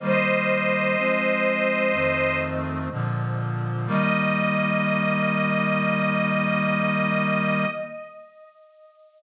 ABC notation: X:1
M:4/4
L:1/8
Q:1/4=62
K:Eb
V:1 name="String Ensemble 1"
[ce]5 z3 | e8 |]
V:2 name="Brass Section"
[E,G,B,]2 [F,A,C]2 [F,,E,=A,C]2 [B,,D,F,]2 | [E,G,B,]8 |]